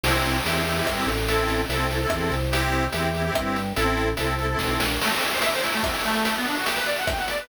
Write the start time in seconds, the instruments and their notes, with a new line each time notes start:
0.03 drawbar organ C2, accordion E4 G4, crash
0.09 accordion C4
0.24 closed hi-hat
0.45 drawbar organ E2, accordion E4 G4, closed hi-hat
0.51 accordion C4
0.66 accordion E4 G4, closed hi-hat
0.71 accordion C4
0.76 accordion E4 G4
0.81 accordion C4
0.86 drawbar organ G2, kick, cross-stick
1.07 drawbar organ A1, closed hi-hat
1.28 accordion E4 A4, closed hi-hat
1.33 accordion C4
1.48 closed hi-hat
1.69 drawbar organ C2, accordion A4, closed hi-hat
1.74 accordion C4 E4
1.90 accordion E4 A4, closed hi-hat
1.95 accordion C4
2.01 accordion E4 A4
2.07 accordion C4, cross-stick
2.11 drawbar organ E2, kick
2.30 drawbar organ C2, closed hi-hat
2.51 accordion E4 G4, closed hi-hat
2.57 accordion C4
2.72 closed hi-hat
2.92 drawbar organ E2, accordion E4 G4, closed hi-hat
2.98 accordion C4
3.14 accordion E4 G4, closed hi-hat
3.20 accordion C4
3.24 accordion E4 G4
3.29 accordion C4
3.35 drawbar organ G2, kick, cross-stick
3.56 closed hi-hat
3.76 drawbar organ A1, accordion E4 A4, closed hi-hat
3.81 accordion C4
3.97 closed hi-hat
4.17 drawbar organ C2, accordion E4 A4, closed hi-hat
4.23 accordion C4
4.38 accordion E4 A4, closed hi-hat
4.44 accordion C4
4.49 accordion E4 A4
4.55 accordion C4
4.59 drawbar organ B1, kick, snare
4.80 drawbar organ A#1, snare
5.01 accordion A3, crash
5.11 accordion C4, closed hi-hat
5.21 accordion E4, closed hi-hat
5.31 accordion C5, closed hi-hat
5.41 accordion E5, closed hi-hat
5.52 accordion C5, closed hi-hat
5.62 accordion E4, closed hi-hat
5.73 accordion A3, closed hi-hat
5.83 accordion C4, kick, cross-stick
5.93 accordion E4, closed hi-hat
6.04 accordion A3, closed hi-hat
6.14 closed hi-hat
6.25 closed hi-hat
6.35 accordion B3, closed hi-hat
6.46 accordion D4, closed hi-hat
6.55 accordion F#4, closed hi-hat
6.65 accordion G4, closed hi-hat
6.76 accordion B4, closed hi-hat
6.86 accordion D5, closed hi-hat
6.96 accordion F#5, closed hi-hat
7.07 accordion G5, kick, cross-stick
7.18 accordion F#5, closed hi-hat
7.28 accordion D5, closed hi-hat
7.38 accordion B4, closed hi-hat